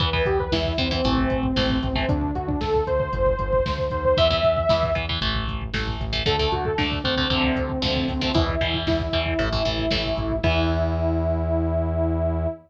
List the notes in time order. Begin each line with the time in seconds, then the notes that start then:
0.00 E2 E3 B3 B4, kick, closed hi-hat
0.13 E3 B3, kick
0.26 E2 G4, kick, closed hi-hat
0.39 B4, kick
0.52 E2 E3 B3 E4, kick, snare
0.65 kick
0.78 E2 E3 B3 C4, kick, closed hi-hat
0.91 E3 B3 C4, kick
1.04 A1 E3 A3, kick, closed hi-hat
1.18 kick
1.30 A1, kick, closed hi-hat
1.43 kick
1.56 A1 E3 A3, kick, snare
1.70 kick
1.82 A1 C4, kick, closed hi-hat
1.95 E3 A3 C4, kick
2.09 D2 D4, kick, closed hi-hat
2.21 kick
2.35 D2 F#4, kick, closed hi-hat
2.48 D4, kick
2.61 D2 A4, kick, snare
2.74 kick
2.87 D2 C5, kick, closed hi-hat
3.00 C5, kick
3.12 G1, kick, closed hi-hat
3.26 kick
3.39 G1, kick, closed hi-hat
3.53 kick
3.65 D2, kick, snare
3.78 kick
3.90 D#2 C5, kick, closed hi-hat
4.05 C5, kick
4.17 E2 E3 B3 E5, kick, closed hi-hat
4.30 E3 B3, kick
4.43 E2, kick, closed hi-hat
4.56 kick
4.69 E2 E3 B3, kick, snare
4.83 kick
4.95 E2 E3 B3, kick, closed hi-hat
5.09 E3 B3, kick
5.21 A1 E3 A3, kick, closed hi-hat
5.35 kick
5.47 A1, kick, closed hi-hat
5.62 kick
5.73 A1 E3 A3, kick, snare
5.87 kick
6.00 A1, kick, closed hi-hat
6.13 E3 A3, kick
6.26 D2 D3 A3 A4, kick, closed hi-hat
6.39 D3 A3, kick
6.52 D2 F#4, kick, closed hi-hat
6.65 A4, kick
6.78 D2 D3 A3 D4, kick, snare
6.91 kick
7.04 D2 D3 A3 C4, kick, closed hi-hat
7.17 D3 A3 C4, kick
7.30 D2 C3 D3 F3 A3, kick, closed hi-hat
7.44 kick
7.56 D2, kick, closed hi-hat
7.70 kick
7.82 D2 C3 D3 F3 A3, kick, snare
7.96 kick
8.08 D2 C4, kick, open hi-hat
8.21 C3 D3 F3 A3 C4, kick
8.34 E2 B2 E3 E4, kick, closed hi-hat
8.48 kick
8.61 E2 B2 E3, kick, closed hi-hat
8.74 kick
8.87 E2 E4, kick, snare
8.99 kick
9.12 E2 B2 E3, kick, closed hi-hat
9.26 kick
9.39 A1 A2 E3, kick, closed hi-hat
9.52 A2 E3, kick
9.65 A1 A2 E3, kick, closed hi-hat
9.78 kick
9.91 A1 A2 E3, kick, snare
10.05 kick
10.17 A1, kick, closed hi-hat
10.30 kick
10.43 E2 E3 B3 E4, kick, crash